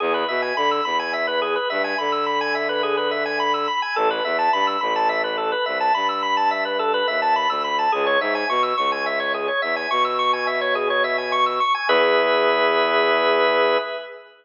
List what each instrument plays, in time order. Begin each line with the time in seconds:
0.00 violin E2, drawbar organ G#4
0.14 drawbar organ B4
0.28 violin B2, drawbar organ E5
0.42 drawbar organ G#5
0.56 violin D3, drawbar organ B5
0.71 drawbar organ E6
0.85 violin E2, drawbar organ B5
0.99 drawbar organ G#5
1.13 drawbar organ E5
1.27 drawbar organ B4
1.42 drawbar organ G#4
1.56 drawbar organ B4
1.70 violin G2, drawbar organ E5
1.84 drawbar organ G#5
1.98 violin D3, drawbar organ B5
2.12 drawbar organ E6
2.26 drawbar organ B5
2.41 drawbar organ G#5
2.55 drawbar organ E5
2.69 drawbar organ B4
2.83 drawbar organ G#4
2.97 drawbar organ B4
3.11 drawbar organ E5
3.25 drawbar organ G#5
3.40 drawbar organ B5
3.54 drawbar organ E6
3.68 drawbar organ B5
3.82 drawbar organ G#5
3.96 violin A1, drawbar organ A4
4.10 drawbar organ B4
4.24 violin E2, drawbar organ E5
4.39 drawbar organ A5
4.53 violin G2, drawbar organ B5
4.67 drawbar organ E6
4.81 violin A1, drawbar organ B5
4.96 drawbar organ A5
5.09 drawbar organ E5
5.24 drawbar organ B4
5.38 drawbar organ A4
5.52 drawbar organ B4
5.66 violin C2, drawbar organ E5
5.80 drawbar organ A5
5.94 violin G2, drawbar organ B5
6.09 drawbar organ E6
6.23 drawbar organ B5
6.37 drawbar organ A5
6.51 drawbar organ E5
6.65 drawbar organ B4
6.79 drawbar organ A4
6.94 drawbar organ B4
7.08 violin D#2, drawbar organ E5
7.22 drawbar organ A5
7.36 drawbar organ B5
7.49 violin D2, drawbar organ E6
7.64 drawbar organ B5
7.79 drawbar organ A5
7.92 violin C#2, drawbar organ G#4
8.06 drawbar organ C#5
8.20 violin G#2, drawbar organ E5
8.35 drawbar organ G#5
8.49 violin B2, drawbar organ C#6
8.63 drawbar organ E6
8.77 violin C#2, drawbar organ C#6
8.92 drawbar organ G#5
9.06 drawbar organ E5
9.20 drawbar organ C#5
9.34 drawbar organ G#4
9.48 drawbar organ C#5
9.62 violin E2, drawbar organ E5
9.76 drawbar organ G#5
9.91 violin B2, drawbar organ C#6
10.05 drawbar organ E6
10.19 drawbar organ C#6
10.33 drawbar organ G#5
10.47 drawbar organ E5
10.61 drawbar organ C#5
10.75 drawbar organ G#4
10.90 drawbar organ C#5
11.04 drawbar organ E5
11.18 drawbar organ G#5
11.32 drawbar organ C#6
11.46 drawbar organ E6
11.60 drawbar organ C#6
11.75 drawbar organ G#5
11.88 violin E2, drawbar organ G#4 B4 E5